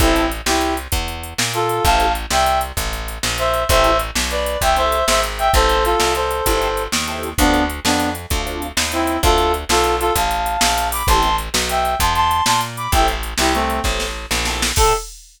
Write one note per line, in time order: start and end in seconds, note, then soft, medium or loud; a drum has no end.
0.00 0.42 A1 loud
0.00 0.21 C4 loud
0.00 0.26 C4 medium
0.00 0.21 E4 loud
0.00 0.26 E4 medium
0.00 0.21 G4 loud
0.00 0.21 A4 loud
0.00 kick loud
0.00 closed hi-hat loud
0.16 closed hi-hat medium
0.32 closed hi-hat medium
0.46 0.88 C2 loud
0.46 0.74 E4 medium
0.46 0.74 G4 medium
0.46 snare loud
0.61 closed hi-hat medium
0.77 closed hi-hat medium
0.92 1.34 E2 medium
0.92 kick medium
0.92 closed hi-hat loud
1.08 closed hi-hat medium
1.23 closed hi-hat medium
1.38 1.80 A#2 loud
1.38 snare loud
1.54 1.83 F4 medium
1.54 1.83 A4 medium
1.54 closed hi-hat medium
1.69 closed hi-hat medium
1.84 2.26 A1 loud
1.84 2.06 C4 loud
1.84 2.06 E4 loud
1.84 2.06 G4 loud
1.84 2.06 A4 loud
1.84 2.12 F5 medium
1.84 2.12 A5 medium
1.84 kick loud
1.84 closed hi-hat medium
2.00 closed hi-hat medium
2.15 closed hi-hat medium
2.31 2.72 C2 loud
2.31 2.59 E5 medium
2.31 2.59 G5 medium
2.31 snare loud
2.46 closed hi-hat medium
2.61 closed hi-hat medium
2.77 3.18 A1 medium
2.77 kick medium
2.77 closed hi-hat loud
2.93 closed hi-hat medium
3.08 closed hi-hat medium
3.23 3.65 A#1 loud
3.23 snare loud
3.38 3.63 C5 medium
3.38 3.63 E5 medium
3.38 closed hi-hat medium
3.54 closed hi-hat medium
3.69 4.11 A1 loud
3.69 3.91 C4 loud
3.69 3.91 E4 loud
3.69 3.91 G4 loud
3.69 3.91 A4 loud
3.69 3.97 C5 medium
3.69 3.97 E5 medium
3.69 kick loud
3.69 closed hi-hat loud
3.84 closed hi-hat medium
3.99 closed hi-hat medium
4.15 4.57 B1 medium
4.15 snare loud
4.31 4.58 B4 medium
4.31 4.58 D5 medium
4.31 closed hi-hat medium
4.46 closed hi-hat medium
4.61 5.03 C2 loud
4.61 4.76 E5 medium
4.61 4.76 G5 medium
4.61 kick medium
4.61 closed hi-hat loud
4.76 4.98 C4 medium
4.76 4.98 E4 loud
4.76 4.98 G4 medium
4.76 4.98 A4 loud
4.76 5.05 C5 medium
4.76 5.05 E5 medium
4.76 closed hi-hat medium
4.92 closed hi-hat medium
5.08 5.49 G#1 loud
5.08 5.21 C5 medium
5.08 5.21 E5 medium
5.08 snare loud
5.23 closed hi-hat medium
5.39 5.51 E5 medium
5.39 5.51 G5 medium
5.39 closed hi-hat medium
5.54 5.95 A1 loud
5.54 5.75 C4 loud
5.54 5.75 E4 loud
5.54 5.75 G4 loud
5.54 5.84 A4 medium
5.54 5.75 A4 loud
5.54 5.84 C5 medium
5.54 kick loud
5.54 closed hi-hat medium
5.69 closed hi-hat medium
5.85 6.13 F4 medium
5.85 6.13 A4 medium
5.85 closed hi-hat medium
6.00 6.42 C2 medium
6.00 snare loud
6.15 6.83 A4 medium
6.15 6.83 C5 medium
6.15 closed hi-hat medium
6.31 closed hi-hat medium
6.46 6.88 G1 medium
6.46 6.68 C4 loud
6.46 6.68 E4 loud
6.46 6.68 G4 loud
6.46 6.68 A4 loud
6.46 kick medium
6.46 closed hi-hat loud
6.62 closed hi-hat medium
6.77 closed hi-hat medium
6.92 7.34 D#2 loud
6.92 snare loud
7.08 7.29 C4 medium
7.08 7.29 E4 loud
7.08 7.29 G4 loud
7.08 7.29 A4 medium
7.08 closed hi-hat medium
7.23 closed hi-hat medium
7.38 7.80 D2 loud
7.38 7.64 B3 medium
7.38 7.60 C4 loud
7.38 7.64 D4 medium
7.38 7.60 D4 loud
7.38 7.60 F4 loud
7.38 7.60 A4 loud
7.38 kick loud
7.38 closed hi-hat loud
7.54 closed hi-hat medium
7.70 closed hi-hat medium
7.85 8.26 F2 loud
7.85 8.09 B3 medium
7.85 8.09 D4 medium
7.85 snare loud
8.00 closed hi-hat medium
8.15 closed hi-hat medium
8.30 8.72 D2 medium
8.30 8.42 C4 medium
8.30 8.42 D4 medium
8.30 8.42 F4 loud
8.30 8.42 A4 loud
8.30 kick medium
8.30 closed hi-hat medium
8.46 8.67 C4 medium
8.46 8.67 D4 medium
8.46 8.67 F4 loud
8.46 8.67 A4 medium
8.46 closed hi-hat medium
8.62 closed hi-hat medium
8.77 9.18 D#2 loud
8.77 snare loud
8.92 9.17 C4 medium
8.92 9.17 E4 medium
8.92 closed hi-hat medium
9.07 closed hi-hat medium
9.23 9.65 D2 loud
9.23 9.45 C4 loud
9.23 9.45 D4 loud
9.23 9.52 F4 medium
9.23 9.45 F4 loud
9.23 9.52 A4 medium
9.23 9.45 A4 loud
9.23 kick loud
9.23 closed hi-hat loud
9.38 closed hi-hat medium
9.54 closed hi-hat medium
9.69 10.11 B1 loud
9.69 9.95 F4 medium
9.69 9.95 A4 medium
9.69 snare loud
9.84 closed hi-hat medium
10.00 10.13 F4 medium
10.00 10.13 A4 medium
10.00 closed hi-hat medium
10.15 10.57 A1 medium
10.15 10.88 F5 medium
10.15 10.88 A5 medium
10.15 kick medium
10.15 closed hi-hat loud
10.31 closed hi-hat medium
10.46 closed hi-hat medium
10.61 11.03 A#1 loud
10.61 snare loud
10.78 closed hi-hat medium
10.92 11.07 B5 medium
10.92 11.07 D6 medium
10.92 open hi-hat medium
11.07 11.49 A1 loud
11.07 11.29 C4 loud
11.07 11.29 E4 loud
11.07 11.29 G4 loud
11.07 11.29 A4 loud
11.07 11.36 A5 medium
11.07 11.36 C6 medium
11.07 kick loud
11.07 closed hi-hat loud
11.23 closed hi-hat medium
11.38 closed hi-hat medium
11.54 11.95 B1 loud
11.54 snare loud
11.69 11.94 E5 medium
11.69 11.94 G5 medium
11.69 closed hi-hat medium
11.85 closed hi-hat medium
12.00 12.42 E2 loud
12.00 12.13 A5 medium
12.00 12.13 C6 medium
12.00 kick medium
12.00 closed hi-hat loud
12.15 12.43 A5 medium
12.15 12.43 C6 medium
12.15 closed hi-hat medium
12.31 closed hi-hat medium
12.46 12.88 A#2 medium
12.46 12.60 A5 medium
12.46 12.60 C6 medium
12.46 snare loud
12.61 closed hi-hat medium
12.77 12.91 B5 medium
12.77 12.91 D6 medium
12.77 closed hi-hat medium
12.92 13.34 A1 loud
12.92 13.14 C4 loud
12.92 13.14 E4 loud
12.92 13.14 G4 loud
12.92 13.14 A4 loud
12.92 13.07 E5 medium
12.92 13.07 G5 medium
12.92 kick loud
12.92 closed hi-hat loud
13.08 closed hi-hat medium
13.23 closed hi-hat medium
13.38 13.80 C2 loud
13.38 13.53 E4 medium
13.38 13.53 G4 medium
13.38 snare loud
13.54 13.80 A3 medium
13.54 13.80 C4 medium
13.54 closed hi-hat medium
13.70 closed hi-hat medium
13.84 14.26 A1 medium
13.84 14.06 C4 loud
13.84 14.06 E4 medium
13.84 14.06 G4 medium
13.84 14.06 A4 medium
13.84 kick medium
13.84 snare medium
14.00 snare medium
14.31 14.72 A#1 loud
14.31 snare medium
14.45 14.68 C4 loud
14.45 14.68 E4 medium
14.45 14.68 G4 medium
14.45 14.68 A4 loud
14.45 snare medium
14.62 snare loud
14.76 14.93 A2 loud
14.76 14.93 C4 loud
14.76 14.93 E4 loud
14.76 14.93 G4 loud
14.76 14.93 A4 loud
14.76 14.93 A4 medium
14.76 kick loud
14.76 crash loud